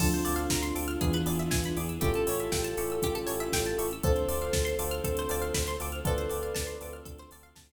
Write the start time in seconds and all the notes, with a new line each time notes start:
0.00 D2 F3 C4 D4 F4 A4, kick, crash
0.13 C5, closed hi-hat
0.25 D2 C4 D4 F4 A4 D5, open hi-hat
0.36 F5, closed hi-hat
0.50 D2 A#5, kick, snare
0.63 C6, closed hi-hat
0.75 D2 C4 D4 F4 A4 D6, open hi-hat
0.88 F6, closed hi-hat
1.01 E2 E3 B3 D4 E4 G#4, kick, closed hi-hat
1.13 B4, closed hi-hat
1.26 E2 B3 D4 E4 G#4 D5, open hi-hat
1.39 E5, closed hi-hat
1.51 E2 G#5, kick, snare
1.64 B5, closed hi-hat
1.76 E2 B3 D4 E4 G#4 D6, open hi-hat
1.89 E6, closed hi-hat
2.00 A1 C#4 E4 F4 G4 A4, kick, closed hi-hat
2.14 A4, closed hi-hat
2.27 A1 C#4 E4 G4 A4 C#5, open hi-hat
2.39 E5, closed hi-hat
2.52 A1 G5, kick, snare
2.64 A5, closed hi-hat
2.77 A1 C#4 E4 G4 A4 C#6, open hi-hat
2.90 E6, closed hi-hat
3.02 A1 C#4 G4, kick, closed hi-hat
3.15 A4, closed hi-hat
3.27 A1 C#4 E4 G4 A4 C#5, open hi-hat
3.40 E5, closed hi-hat
3.52 A1 G5, kick, snare
3.65 A5, closed hi-hat
3.78 A1 C#4 E4 G4 A4 C#6, open hi-hat
3.91 E6, closed hi-hat
4.02 D2 C4 D4 F4 A4 C5, kick, closed hi-hat
4.16 C5, closed hi-hat
4.28 D2 C4 D4 F4 A4 D5, open hi-hat
4.41 F5, closed hi-hat
4.53 D2 A5, kick, snare
4.65 C6, closed hi-hat
4.79 D2 C4 D4 F4 A4 D6, open hi-hat
4.91 F6, closed hi-hat
5.04 D2 A4 C5, kick, closed hi-hat
5.17 C5, closed hi-hat
5.29 D2 C4 D4 F4 A4 D5, open hi-hat
5.42 F5, closed hi-hat
5.54 D2 B5, kick, snare
5.67 C6, closed hi-hat
5.80 D2 C4 D4 F4 A4 D6, open hi-hat
5.92 F6, closed hi-hat
6.04 D2 C4 D4 F4 A4 B4 D5, kick, closed hi-hat
6.18 C5, closed hi-hat
6.30 D2 C4 D4 F4 A4 D5, open hi-hat
6.43 F5, closed hi-hat
6.55 D2 A5, kick, snare
6.67 C6, closed hi-hat
6.81 D2 C4 D4 F4 A4 D6, open hi-hat
6.93 F6, closed hi-hat
7.05 D2 A4, kick, closed hi-hat
7.18 C5, closed hi-hat
7.31 D2 C4 D4 F4 A4 D5, open hi-hat
7.43 F5, closed hi-hat
7.56 D2 A5, kick, snare
7.69 C6, closed hi-hat